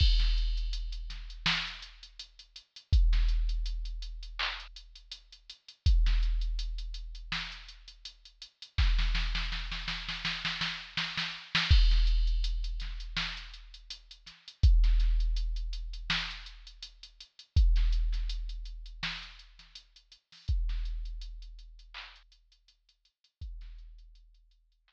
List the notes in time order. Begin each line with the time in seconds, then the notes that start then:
0.00 kick, crash
0.19 snare, closed hi-hat
0.37 closed hi-hat
0.57 closed hi-hat
0.73 closed hi-hat
0.92 closed hi-hat
1.10 snare, closed hi-hat
1.30 closed hi-hat
1.46 snare
1.67 closed hi-hat
1.82 closed hi-hat
2.03 closed hi-hat
2.19 closed hi-hat
2.39 closed hi-hat
2.56 closed hi-hat
2.76 closed hi-hat
2.93 kick, closed hi-hat
3.13 snare, closed hi-hat
3.29 closed hi-hat
3.49 closed hi-hat
3.66 closed hi-hat
3.85 closed hi-hat
4.02 closed hi-hat
4.23 closed hi-hat
4.39 clap
4.60 closed hi-hat
4.76 closed hi-hat
4.95 closed hi-hat
5.12 closed hi-hat
5.32 closed hi-hat
5.50 closed hi-hat
5.68 closed hi-hat
5.86 kick, closed hi-hat
6.06 snare, closed hi-hat
6.23 closed hi-hat
6.41 closed hi-hat
6.59 closed hi-hat
6.78 closed hi-hat
6.94 closed hi-hat
7.15 closed hi-hat
7.32 snare
7.52 closed hi-hat
7.68 closed hi-hat
7.88 closed hi-hat
8.05 closed hi-hat
8.25 closed hi-hat
8.42 closed hi-hat
8.62 closed hi-hat
8.78 kick, snare
8.98 snare
9.15 snare
9.35 snare
9.52 snare
9.72 snare
9.88 snare
10.09 snare
10.25 snare
10.45 snare
10.61 snare
10.97 snare
11.17 snare
11.55 snare
11.71 kick, crash
11.91 snare, closed hi-hat
12.07 closed hi-hat
12.27 closed hi-hat
12.44 closed hi-hat
12.64 closed hi-hat
12.80 snare, closed hi-hat
13.00 closed hi-hat
13.17 snare
13.37 closed hi-hat
13.54 closed hi-hat
13.74 closed hi-hat
13.90 closed hi-hat
14.11 closed hi-hat
14.26 snare, closed hi-hat
14.48 closed hi-hat
14.63 kick, closed hi-hat
14.84 snare, closed hi-hat
15.00 snare, closed hi-hat
15.20 closed hi-hat
15.36 closed hi-hat
15.56 closed hi-hat
15.73 closed hi-hat
15.93 closed hi-hat
16.10 snare
16.31 closed hi-hat
16.46 closed hi-hat
16.67 closed hi-hat
16.82 closed hi-hat
17.03 closed hi-hat
17.20 closed hi-hat
17.39 closed hi-hat
17.56 kick, closed hi-hat
17.76 snare, closed hi-hat
17.93 closed hi-hat
18.12 snare, closed hi-hat
18.29 closed hi-hat
18.49 closed hi-hat
18.65 closed hi-hat
18.86 closed hi-hat
19.03 snare
19.23 closed hi-hat
19.39 closed hi-hat
19.59 snare, closed hi-hat
19.75 closed hi-hat
19.96 closed hi-hat
20.12 closed hi-hat
20.32 snare, open hi-hat
20.48 kick, closed hi-hat
20.69 snare, closed hi-hat
20.85 closed hi-hat
21.05 closed hi-hat
21.21 closed hi-hat
21.42 closed hi-hat
21.59 closed hi-hat
21.79 closed hi-hat
21.94 clap
22.16 closed hi-hat
22.32 closed hi-hat
22.52 closed hi-hat
22.68 closed hi-hat
22.89 closed hi-hat
23.05 closed hi-hat
23.24 closed hi-hat
23.41 kick, closed hi-hat
23.61 snare, closed hi-hat
23.79 closed hi-hat
23.98 closed hi-hat
24.15 closed hi-hat
24.34 closed hi-hat
24.51 closed hi-hat
24.72 closed hi-hat
24.88 clap